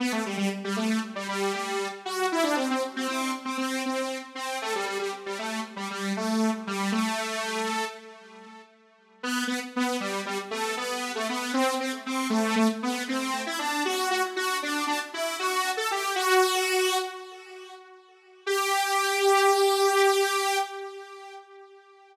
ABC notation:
X:1
M:9/8
L:1/16
Q:3/8=78
K:G
V:1 name="Lead 2 (sawtooth)"
B, A, G, G, z G, A,2 z G, G,2 G,3 z F2 | E D C C z C C2 z C C2 C3 z C2 | A, G, G, G, z G, A,2 z G, G,2 A,3 z G,2 | A,8 z10 |
B,2 B, z B,2 G,2 G, z A,2 B,3 A, B,2 | C2 C z C2 A,2 A, z B,2 C3 E D2 | F2 F z F2 D2 D z E2 F3 A G2 | F8 z10 |
G18 |]